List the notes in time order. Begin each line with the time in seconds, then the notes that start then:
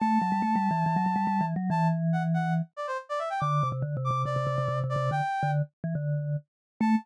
0.00 A3 A5
0.22 F#3
0.32 G3
0.42 A3
0.56 G3
0.71 E3
0.86 E3
0.96 F#3
1.06 F#3
1.16 G3
1.27 G3
1.41 E3
1.56 F#3
1.70 E3 A5
2.13 F#5
2.34 F#5
2.77 D5
2.87 C5
3.09 D5
3.19 E5
3.30 G5
3.40 D3 D6
3.63 C3
3.72 C3
3.82 D3
3.97 C3
4.05 D6
4.11 C3
4.25 C3 D5
4.36 C3
4.47 C3
4.58 C3
4.68 C3
4.84 C3
4.89 D5
4.96 C3
5.11 D3 G5
5.43 D3
5.84 E3
5.95 D3
6.80 A3 A5